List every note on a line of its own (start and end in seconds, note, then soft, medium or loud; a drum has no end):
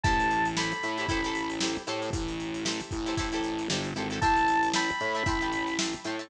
0.04 0.73 A1 loud
0.04 0.47 E4 loud
0.04 0.47 G4 loud
0.04 0.47 A4 loud
0.04 0.47 C5 loud
0.04 0.48 A5 medium
0.04 kick loud
0.04 closed hi-hat medium
0.20 closed hi-hat medium
0.31 closed hi-hat medium
0.45 closed hi-hat medium
0.57 0.89 E4 medium
0.57 0.89 G4 medium
0.57 0.89 A4 medium
0.57 0.89 C5 medium
0.57 1.50 B5 medium
0.57 snare loud
0.72 closed hi-hat medium
0.82 1.06 A2 medium
0.82 snare soft
0.82 closed hi-hat medium
0.97 1.07 E4 loud
0.97 1.07 G4 medium
0.97 1.07 A4 medium
0.97 1.07 C5 loud
0.97 closed hi-hat medium
1.08 1.77 A1 loud
1.08 1.21 E4 loud
1.08 1.21 G4 loud
1.08 1.21 A4 loud
1.08 1.21 C5 loud
1.08 kick medium
1.08 closed hi-hat medium
1.24 1.55 E4 medium
1.24 1.55 G4 medium
1.24 1.55 A4 loud
1.24 1.55 C5 medium
1.24 snare soft
1.24 closed hi-hat medium
1.35 closed hi-hat medium
1.50 closed hi-hat medium
1.61 1.83 E4 medium
1.61 1.83 G4 medium
1.61 1.83 A4 medium
1.61 1.83 C5 loud
1.61 snare loud
1.76 closed hi-hat medium
1.87 2.10 A2 medium
1.87 2.56 E4 medium
1.87 2.56 G4 loud
1.87 2.56 A4 loud
1.87 2.56 C5 loud
1.87 snare soft
1.87 closed hi-hat medium
2.02 closed hi-hat medium
2.13 2.81 A1 loud
2.13 kick medium
2.13 closed hi-hat loud
2.28 closed hi-hat medium
2.40 closed hi-hat medium
2.54 closed hi-hat medium
2.65 2.97 E4 loud
2.65 2.97 G4 medium
2.65 2.97 A4 loud
2.65 2.97 C5 loud
2.65 snare loud
2.80 closed hi-hat medium
2.91 3.68 A1 loud
2.91 kick medium
2.91 closed hi-hat medium
3.06 3.15 E4 loud
3.06 3.15 G4 medium
3.06 3.15 A4 medium
3.06 3.15 C5 medium
3.06 snare soft
3.06 closed hi-hat medium
3.17 3.29 E4 loud
3.17 3.29 G4 loud
3.17 3.29 A4 loud
3.17 3.29 C5 loud
3.17 kick medium
3.17 closed hi-hat loud
3.32 3.63 E4 medium
3.32 3.63 G4 medium
3.32 3.63 A4 medium
3.32 3.63 C5 medium
3.32 closed hi-hat medium
3.44 closed hi-hat medium
3.59 closed hi-hat medium
3.70 3.94 G1 medium
3.70 3.91 E4 medium
3.70 3.91 G4 medium
3.70 3.91 A4 medium
3.70 3.91 C5 medium
3.70 snare loud
3.84 closed hi-hat medium
3.96 4.20 G#1 medium
3.96 4.08 E4 medium
3.96 4.08 G4 loud
3.96 4.08 A4 medium
3.96 4.08 C5 medium
3.96 closed hi-hat medium
4.10 4.20 E4 medium
4.10 4.20 G4 medium
4.10 4.20 A4 loud
4.10 4.20 C5 loud
4.10 closed hi-hat medium
4.21 4.91 A1 loud
4.21 4.65 E5 loud
4.21 4.65 G5 loud
4.21 4.69 A5 loud
4.21 4.65 A5 loud
4.21 4.65 C6 loud
4.21 kick medium
4.21 closed hi-hat loud
4.36 closed hi-hat medium
4.48 closed hi-hat medium
4.63 closed hi-hat medium
4.74 5.06 E5 medium
4.74 5.06 G5 loud
4.74 5.06 A5 loud
4.74 5.74 B5 medium
4.74 5.06 C6 medium
4.74 snare loud
4.89 closed hi-hat medium
5.00 5.23 A2 loud
5.00 closed hi-hat medium
5.15 5.24 E5 medium
5.15 5.24 G5 medium
5.15 5.24 A5 medium
5.15 5.24 C6 medium
5.15 closed hi-hat medium
5.26 5.94 A1 loud
5.26 5.38 E5 loud
5.26 5.38 G5 loud
5.26 5.38 A5 loud
5.26 5.38 C6 loud
5.26 kick medium
5.26 closed hi-hat medium
5.41 5.72 E5 medium
5.41 5.72 G5 medium
5.41 5.72 A5 medium
5.41 5.72 C6 medium
5.41 closed hi-hat medium
5.52 closed hi-hat medium
5.67 snare soft
5.67 closed hi-hat medium
5.79 6.00 E5 medium
5.79 6.00 G5 medium
5.79 6.00 A5 medium
5.79 6.00 C6 medium
5.79 snare loud
5.93 closed hi-hat medium
6.04 6.28 A2 medium
6.04 6.17 E5 medium
6.04 6.17 G5 loud
6.04 6.17 A5 medium
6.04 6.17 C6 loud
6.04 snare soft
6.04 closed hi-hat medium
6.19 6.28 E5 loud
6.19 6.28 G5 medium
6.19 6.28 A5 loud
6.19 6.28 C6 medium
6.19 closed hi-hat medium